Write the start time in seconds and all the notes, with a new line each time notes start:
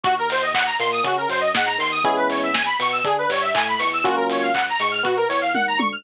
0.04 D#2 F#4, kick, closed hi-hat
0.18 A#4
0.30 C5, open hi-hat
0.42 D#5
0.54 F#5, kick, clap
0.65 A#5
0.79 A#2 A#3 C6, open hi-hat
0.92 D#6
1.04 C#3 C#4 F#4, kick, closed hi-hat
1.17 A#4
1.28 F#2 F#3 C5, open hi-hat
1.41 D#5
1.54 G#2 G#3 F#5, kick, snare
1.66 A#5
1.78 D#2 D#3 C6, open hi-hat
1.91 D#6
2.04 E2 G#3 B3 C#4 E4 G#4, kick, closed hi-hat
2.17 B4
2.30 C#5, open hi-hat
2.43 E5
2.54 G#5, kick, snare
2.66 B5
2.79 B2 B3 C#6, open hi-hat
2.92 E6
3.04 D3 D4 G#4, kick, closed hi-hat
3.18 B4
3.29 G2 G3 C#5, open hi-hat
3.42 E5
3.54 A2 A3 G#5, kick, clap
3.68 B5
3.79 E2 E3 C#6, open hi-hat
3.93 E6
4.04 C#2 F#3 A#3 C#4 F4 F#4, kick, closed hi-hat
4.16 A#4
4.29 C#5, open hi-hat
4.42 F5
4.54 F#5, kick, clap
4.69 A#5
4.79 G#2 G#3 C#6, open hi-hat
4.92 F6
5.03 B2 B3 F#4, kick, closed hi-hat
5.17 A#4
5.29 E2 E3 C#5, open hi-hat
5.41 F5
5.54 D#2 D#3 F#5, kick, high tom
5.68 A#5
5.78 D2 D3 C#6, high tom
5.92 F6